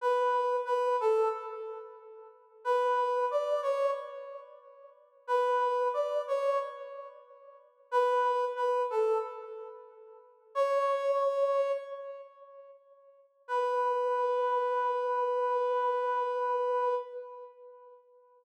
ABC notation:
X:1
M:4/4
L:1/8
Q:1/4=91
K:Bm
V:1 name="Brass Section"
B2 B A z4 | B2 d c z4 | B2 d c z4 | B2 B A z4 |
"^rit." c4 z4 | B8 |]